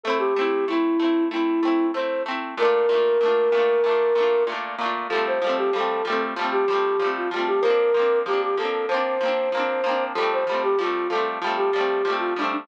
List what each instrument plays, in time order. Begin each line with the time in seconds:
0.04 acoustic guitar (steel) A3 C4, flute A4
0.10 acoustic guitar (steel) E4
0.19 flute G4
0.36 acoustic guitar (steel) A3 C4
0.41 acoustic guitar (steel) E4
0.68 acoustic guitar (steel) A3 C4, flute E4
0.73 acoustic guitar (steel) E4
1.00 acoustic guitar (steel) A3 C4
1.04 acoustic guitar (steel) E4
1.31 acoustic guitar (steel) A3 C4, flute E4
1.36 acoustic guitar (steel) E4
1.63 acoustic guitar (steel) A3 C4
1.68 acoustic guitar (steel) E4
1.94 acoustic guitar (steel) A3 C4, flute C5
1.99 acoustic guitar (steel) E4
2.26 acoustic guitar (steel) A3 C4
2.31 acoustic guitar (steel) E4
2.58 acoustic guitar (steel) A#2 A3, flute A#4
2.62 acoustic guitar (steel) D4 F4
2.89 acoustic guitar (steel) A#2 A3
2.94 acoustic guitar (steel) D4 F4
3.21 acoustic guitar (steel) A#2 A3
3.26 acoustic guitar (steel) D4 F4
3.52 acoustic guitar (steel) A#2 A3
3.57 acoustic guitar (steel) D4 F4
3.84 acoustic guitar (steel) A#2 A3
3.89 acoustic guitar (steel) D4 F4
4.15 acoustic guitar (steel) A#2 A3
4.20 acoustic guitar (steel) D4 F4
4.47 acoustic guitar (steel) A#2 A3
4.52 acoustic guitar (steel) D4 F4
4.79 acoustic guitar (steel) A#2 A3
4.83 acoustic guitar (steel) D4 F4
5.09 acoustic guitar (steel) F3 G3, flute A4
5.15 acoustic guitar (steel) A3 C4
5.27 flute C5
5.42 acoustic guitar (steel) F3 G3
5.47 acoustic guitar (steel) A3 C4
5.58 flute G4
5.73 acoustic guitar (steel) F3 G3, flute A4
5.78 acoustic guitar (steel) A3 C4
6.05 acoustic guitar (steel) F3 G3, flute A4
6.10 acoustic guitar (steel) A3 C4
6.36 acoustic guitar (steel) F3 G3
6.41 acoustic guitar (steel) A3 C4
6.52 flute G4
6.68 acoustic guitar (steel) F3 G3
6.73 acoustic guitar (steel) A3 C4
7.00 acoustic guitar (steel) F3 G3
7.04 acoustic guitar (steel) A3 C4
7.17 flute F4
7.30 acoustic guitar (steel) F3 G3, flute F4
7.36 acoustic guitar (steel) A3 C4
7.47 flute G4
7.61 acoustic guitar (steel) F3 A#3, flute A#4
7.68 acoustic guitar (steel) C4 D4
7.94 acoustic guitar (steel) F3 A#3
7.99 acoustic guitar (steel) C4 D4
8.26 acoustic guitar (steel) F3 A#3, flute G4
8.31 acoustic guitar (steel) C4 D4
8.42 flute G4
8.58 acoustic guitar (steel) F3 A#3, flute A4
8.62 acoustic guitar (steel) C4 D4
8.88 acoustic guitar (steel) F3 A#3, flute C5
8.94 acoustic guitar (steel) C4 D4
9.21 acoustic guitar (steel) F3 A#3
9.26 acoustic guitar (steel) C4 D4
9.52 acoustic guitar (steel) F3 A#3
9.57 acoustic guitar (steel) C4 D4
9.84 acoustic guitar (steel) F3 A#3
9.89 acoustic guitar (steel) C4 D4
10.15 acoustic guitar (steel) F3 G3, flute A4
10.20 acoustic guitar (steel) A3 C4
10.33 flute C5
10.47 acoustic guitar (steel) F3 G3
10.52 acoustic guitar (steel) A3 C4
10.63 flute G4
10.79 acoustic guitar (steel) F3 G3, flute F4
10.83 acoustic guitar (steel) A3 C4
11.10 acoustic guitar (steel) F3 G3, flute A4
11.15 acoustic guitar (steel) A3 C4
11.42 acoustic guitar (steel) F3 G3
11.47 acoustic guitar (steel) A3 C4
11.57 flute G4
11.73 acoustic guitar (steel) F3 G3
11.78 acoustic guitar (steel) A3 C4
12.05 acoustic guitar (steel) F3 G3
12.10 acoustic guitar (steel) A3 C4
12.19 flute F4
12.36 acoustic guitar (steel) F3 G3, flute D4
12.41 acoustic guitar (steel) A3 C4
12.53 flute D4